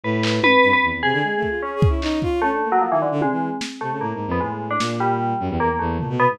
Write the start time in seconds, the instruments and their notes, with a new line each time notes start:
0.03 violin A2, tubular bells B4
0.23 clap
0.43 violin G#2, tubular bells B4, high tom
0.63 violin G2, closed hi-hat
0.73 tubular bells B4
0.83 violin E2
0.93 violin E2
1.03 violin C3, tubular bells G#4
1.13 violin D3
1.23 violin G#3
1.36 violin A3
1.43 kick
1.49 violin F4
1.62 tubular bells C#4, violin G#4
1.76 violin G#4
1.82 kick
1.89 violin E4
2.02 violin D#4, clap
2.22 violin F4, kick
2.42 tubular bells A3, violin C#4
2.52 violin D4
2.62 violin A#3
2.72 tubular bells F#3
2.81 tubular bells F3
2.91 violin D#3, tubular bells E3
3.02 tubular bells D3
3.12 violin D3
3.21 violin C3, tubular bells G#3, high tom
3.31 violin E3
3.61 snare
3.81 violin C3, tubular bells A3
3.91 violin C#3
4.01 violin A2, tubular bells A#3
4.14 violin G#2
4.27 violin F2
4.31 tubular bells B3
4.40 violin A2, tubular bells G#3
4.71 tubular bells D4
4.80 violin A#2, snare
5.00 tubular bells G3
5.40 violin F#2
5.50 violin E2
5.60 violin E2, tubular bells A#3
5.70 violin E2
5.79 violin E2, tubular bells A3
5.99 violin A#2, floor tom
6.09 violin B2
6.20 tubular bells B3
6.30 violin G#2